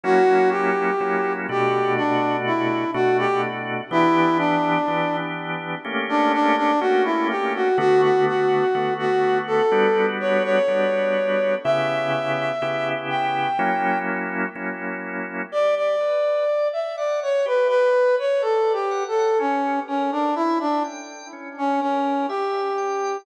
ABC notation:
X:1
M:4/4
L:1/16
Q:1/4=62
K:Bm
V:1 name="Brass Section"
F2 G4 G2 D2 E2 F G z2 | E2 D4 z3 D D D F E G F | F F F3 F2 A3 c c5 | e6 g4 z6 |
d d4 e d c B B2 c (3A2 G2 A2 | C2 C D E D z3 C C2 G4 |]
V:2 name="Drawbar Organ"
[F,^A,CE]4 [F,A,CE]2 [B,,=A,DF]6 [B,,A,DF]4 | [E,B,DG]4 [E,B,DG]4 [A,_B,CG]4 [A,B,CG]4 | [D,A,B,F]4 [D,A,B,F]4 [G,B,DF]4 [G,B,DF]4 | [C,B,EG]4 [C,B,EG]4 [F,^A,CE]4 [F,A,CE]4 |
G2 B2 d2 f2 G2 B2 d2 f2 | C2 _B2 e2 g2 C2 B2 e2 g2 |]